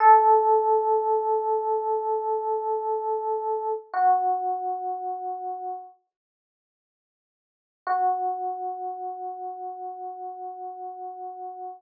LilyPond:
\new Staff { \time 4/4 \key fis \dorian \tempo 4 = 61 a'1 | fis'2 r2 | fis'1 | }